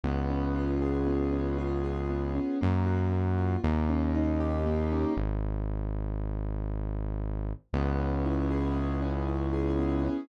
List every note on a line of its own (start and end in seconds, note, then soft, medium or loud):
0.04 2.39 C#2 loud
0.04 1.07 B3 medium
0.30 1.32 C#4 medium
0.55 1.58 F4 medium
0.82 1.83 G#4 medium
1.07 2.09 B3 medium
1.33 2.35 C#4 medium
1.58 2.56 F4 medium
1.84 2.57 G#4 medium
2.10 2.58 B3 medium
2.35 2.59 C#4 medium
2.61 3.57 F#2 loud
2.61 3.12 A#3 medium
2.86 3.59 F#4 medium
3.12 3.61 A#3 medium
3.38 3.62 F4 medium
3.64 5.05 D#2 loud
3.64 4.65 A#3 medium
3.89 4.91 C#4 medium
4.15 5.12 D#4 medium
4.40 5.13 G4 medium
4.66 5.15 A#3 medium
4.92 5.16 C#4 medium
5.17 7.53 G#1 loud
7.73 10.09 C#2 loud
7.73 8.76 B3 medium
7.99 9.01 C#4 medium
8.25 9.27 E4 medium
8.51 9.53 G#4 medium
8.76 9.78 B3 medium
9.02 10.04 C#4 medium
9.28 10.25 E4 medium
9.53 10.26 G#4 medium
9.79 10.28 B3 medium
10.04 10.28 C#4 medium